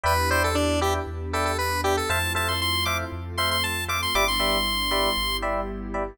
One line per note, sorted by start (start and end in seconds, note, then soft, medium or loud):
0.04 0.99 E2 loud
0.04 1.06 B3 medium
0.04 1.06 D4 medium
0.04 1.06 E4 medium
0.04 1.06 G4 medium
0.04 0.13 B4 loud
0.04 0.30 B4 medium
0.04 0.13 D5 medium
0.04 0.13 E5 medium
0.04 0.13 G5 medium
0.30 0.48 B4 medium
0.30 0.43 C5 medium
0.30 0.48 D5 medium
0.30 0.48 E5 medium
0.30 0.48 G5 medium
0.44 0.56 A4 medium
0.55 0.80 D4 medium
0.81 0.94 G4 medium
0.81 0.99 B4 medium
0.81 0.99 D5 medium
0.81 0.99 E5 medium
0.81 0.99 G5 medium
1.06 2.01 E2 medium
1.06 2.08 B3 medium
1.06 2.08 D4 medium
1.06 2.08 G4 medium
1.06 2.08 B4 medium
1.33 1.45 A4 medium
1.33 1.51 B4 medium
1.33 1.51 D5 medium
1.33 1.51 E5 medium
1.33 1.51 G5 medium
1.45 1.57 A4 medium
1.58 1.81 B4 medium
1.84 1.96 G4 medium
1.84 1.93 B4 medium
1.84 1.93 D5 medium
1.84 1.93 E5 medium
1.84 1.93 G5 medium
1.97 2.09 A4 medium
2.09 3.04 F2 medium
2.09 3.11 A3 medium
2.09 3.11 C4 medium
2.09 3.11 E4 medium
2.09 3.11 F4 medium
2.09 2.18 A4 loud
2.09 2.18 C5 loud
2.09 2.18 E5 medium
2.09 2.18 F5 medium
2.09 2.33 A5 medium
2.35 2.53 A4 medium
2.35 2.53 C5 medium
2.35 2.53 E5 medium
2.35 2.53 F5 medium
2.35 2.48 A5 medium
2.48 2.60 C6 medium
2.61 2.84 C6 medium
2.85 3.04 A4 medium
2.85 3.04 C5 medium
2.85 3.04 E5 medium
2.85 3.04 F5 medium
2.85 2.97 D6 medium
3.12 4.06 F2 medium
3.12 4.14 A3 medium
3.12 4.14 C4 medium
3.12 4.14 F4 medium
3.12 4.14 A4 medium
3.38 3.56 A4 medium
3.38 3.56 C5 medium
3.38 3.56 E5 medium
3.38 3.56 F5 medium
3.38 3.50 C6 medium
3.51 3.63 C6 medium
3.63 3.84 A5 medium
3.88 3.97 A4 medium
3.88 3.97 C5 medium
3.88 3.97 E5 medium
3.88 3.97 F5 medium
3.88 4.01 D6 medium
4.02 4.15 C6 medium
4.14 5.09 G1 medium
4.14 5.15 G3 medium
4.14 5.15 B3 medium
4.14 5.15 D4 medium
4.14 5.15 E4 medium
4.14 4.24 G4 medium
4.14 4.24 B4 loud
4.14 4.24 D5 medium
4.14 4.24 E5 loud
4.14 4.27 D6 loud
4.28 5.37 C6 medium
4.40 4.57 G4 medium
4.40 4.57 B4 medium
4.40 4.57 D5 medium
4.40 4.57 E5 medium
4.91 5.09 G4 medium
4.91 5.09 B4 medium
4.91 5.09 D5 medium
4.91 5.09 E5 medium
5.17 6.12 G1 medium
5.17 6.18 G3 medium
5.17 6.18 B3 medium
5.17 6.18 E4 medium
5.17 6.18 G4 medium
5.42 5.60 G4 medium
5.42 5.60 B4 medium
5.42 5.60 D5 medium
5.42 5.60 E5 medium
5.94 6.03 G4 medium
5.94 6.03 B4 medium
5.94 6.03 D5 medium
5.94 6.03 E5 medium